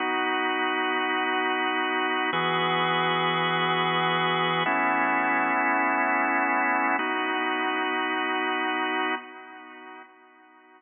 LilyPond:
\new Staff { \time 4/4 \key b \mixolydian \tempo 4 = 103 <b dis' fis'>1 | <e b fis' gis'>1 | <a b cis' e'>1 | <b dis' fis'>1 | }